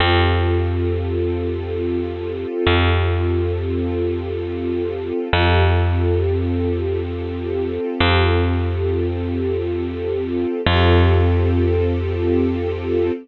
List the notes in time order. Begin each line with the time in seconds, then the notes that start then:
0.00 F2 C4 F4 G4 A4
2.67 F2
5.33 F2 C4 F4 G4 A4
8.00 F2
10.66 F2 C4 F4 G4 A4